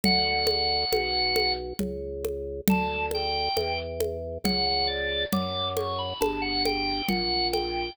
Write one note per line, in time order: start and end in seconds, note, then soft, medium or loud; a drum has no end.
0.04 0.85 D2 loud
0.04 0.46 F#5 loud
0.04 low conga medium
0.47 1.53 F#5 medium
0.47 high conga medium
0.92 1.73 B1 loud
0.92 high conga medium
1.36 high conga medium
1.79 2.61 C#2 loud
1.79 low conga medium
2.25 high conga medium
2.68 3.49 D2 loud
2.68 3.06 A5 medium
2.68 low conga medium
3.11 3.57 G5 medium
3.11 high conga medium
3.57 4.38 E2 loud
3.57 3.78 G5 medium
3.57 high conga medium
4.00 high conga medium
4.44 5.25 C#2 loud
4.44 4.65 F#5 medium
4.44 low conga medium
4.67 4.88 F#5 medium
4.87 5.23 D5 medium
5.32 6.14 F#2 loud
5.32 5.69 D6 loud
5.32 low conga medium
5.77 5.98 C#6 medium
5.77 high conga medium
5.99 6.19 B5 medium
6.21 7.02 G1 loud
6.21 6.42 A5 medium
6.21 high conga medium
6.42 6.63 F#5 medium
6.65 7.07 G5 medium
6.65 high conga medium
7.08 7.90 A#1 loud
7.08 7.47 F#5 medium
7.08 low conga medium
7.53 7.92 G5 medium
7.53 high conga medium